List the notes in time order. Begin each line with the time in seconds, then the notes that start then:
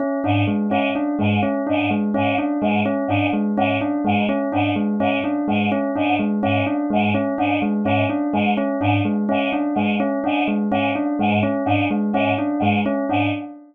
0.00 C#4
0.24 G#2 D4
0.47 G#3
0.69 G#2 C#4
0.95 D4
1.19 G#2 G#3
1.43 C#4
1.67 G#2 D4
1.90 G#3
2.14 G#2 C#4
2.38 D4
2.61 G#2 G#3
2.86 C#4
3.08 G#2 D4
3.33 G#3
3.57 G#2 C#4
3.81 D4
4.05 G#2 G#3
4.29 C#4
4.52 G#2 D4
4.76 G#3
5.00 G#2 C#4
5.24 D4
5.48 G#2 G#3
5.72 C#4
5.96 G#2 D4
6.19 G#3
6.43 G#2 C#4
6.66 D4
6.90 G#2 G#3
7.14 C#4
7.38 G#2 D4
7.62 G#3
7.84 G#2 C#4
8.10 D4
8.33 G#2 G#3
8.57 C#4
8.80 G#2 D4
9.05 G#3
9.29 G#2 C#4
9.52 D4
9.75 G#2 G#3
10.00 C#4
10.24 G#2 D4
10.48 G#3
10.71 G#2 C#4
10.95 D4
11.19 G#2 G#3
11.43 C#4
11.66 G#2 D4
11.90 G#3
12.13 G#2 C#4
12.38 D4
12.60 G#2 G#3
12.86 C#4
13.09 G#2 D4